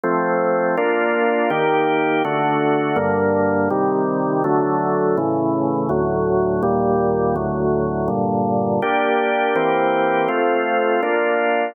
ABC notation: X:1
M:4/4
L:1/8
Q:1/4=82
K:Gm
V:1 name="Drawbar Organ"
[F,A,C]2 [B,DF]2 [E,B,G]2 [D,A,^F]2 | [G,,D,B,]2 [C,E,G,]2 [D,^F,A,]2 [A,,^C,=E,]2 | [D,,A,,^F,]2 [E,,B,,G,]2 [D,,A,,F,]2 [G,,B,,D,]2 | [B,DG]2 [=E,B,CG]2 [A,CF]2 [B,DF]2 |]